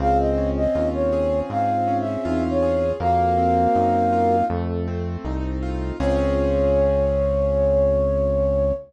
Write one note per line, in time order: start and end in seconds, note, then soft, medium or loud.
0.00 0.67 C#2 loud
0.00 1.50 C4 loud
0.00 0.62 F4 medium
0.00 0.62 G#4 medium
0.00 0.18 F5 loud
0.19 0.50 D#5 loud
0.38 1.87 C#4 medium
0.56 0.88 D#5 loud
0.75 1.42 D#2 medium
0.75 2.05 C#4 medium
0.75 2.25 F4 medium
0.75 2.05 F4 medium
0.94 1.39 C#5 loud
1.12 2.62 G#4 medium
1.50 2.17 G#2 medium
1.50 2.93 C4 medium
1.50 1.97 F5 loud
1.88 2.94 C#4 medium
2.00 2.43 E5 loud
2.25 2.93 E2 medium
2.25 2.85 C4 medium
2.25 2.85 D#4 medium
2.25 2.96 F4 loud
2.50 2.91 C#5 loud
2.62 2.98 G#4 medium
2.99 3.68 F2 loud
2.99 4.42 A#3 loud
2.99 4.36 F#4 medium
2.99 4.36 A#4 medium
2.99 4.45 F5 loud
3.38 4.44 C4 medium
3.75 4.43 F#2 medium
3.75 4.46 D#4 medium
4.12 4.48 F4 medium
4.50 5.17 F2 loud
4.50 5.93 A3 loud
4.88 5.94 C4 medium
5.25 5.92 C2 loud
5.25 5.96 D#4 medium
5.62 5.98 F4 medium
5.99 8.73 C#2 loud
5.99 8.73 C4 loud
5.99 8.73 C#4 loud
5.99 8.73 F4 medium
5.99 8.73 G#4 loud
5.99 8.72 C#5 loud
5.99 8.73 C#5 loud